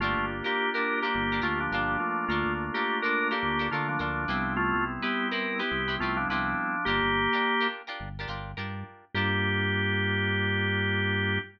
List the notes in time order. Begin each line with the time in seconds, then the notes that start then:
0.00 G1 A3 A#3 D4 F4 G4 A#4
0.17 G1
0.44 A#3 D4 F4 G4 A#4
0.74 D4 F4 G4 A#4
1.02 A#3 D4 F4 G4 A#4
1.14 G1 A#3 D4 F4 G4
1.32 D4 F4 G4 A#4
1.42 D2 A3 D4 F4 G4 A#4
1.60 F3 D4
1.72 G1 F3 D4 F4 G4 A#4
2.00 A3 A#3 D4 F4
2.28 D2 A3 D4 F4 A4 A#4
2.46 D2
2.74 A#3 D4 F4 G4 A4 A#4
3.02 D4 F4 A4 A#4
3.31 A#3 D4 F4 G4 A4 A#4
3.43 D2 A3 A#3 D4 F4
3.59 D4 F4 A4 A#4
3.71 D3 A3 D4 F4 A4 A#4
3.88 F3 D4
3.99 D2 F3 D4 F4 A4 A#4
4.28 C2 G3 B3 C4 E4 G4 B4
4.57 A3 F4
4.74 C2
5.02 B3 C4 E4 G4 B4
5.31 C4 E4 G4 A#4 B4
5.59 B3 C4 E4 G4 B4
5.71 C2 G3 B3 C4 E4
5.88 C4 E4 G4 B4
6.00 C2 A3 C4 E4 F4 G4 B4
6.17 F3 D4
6.29 C2 F3 C4 D4 E4 G4 B4
6.85 G1 A#3 D4 F4 G4 A#4
7.03 G1
7.33 D4 F4 G4 A#4
7.61 D4 F4 G4 A#4
7.87 D4 F4 G4 A#4
8.00 G1
8.19 D4 F4 G4 A#4
8.28 G1 D4 F4 G4 A#4
8.57 G2 D4 F4 G4 A#4
9.14 G2 A#3 D4 F4 G4 A#4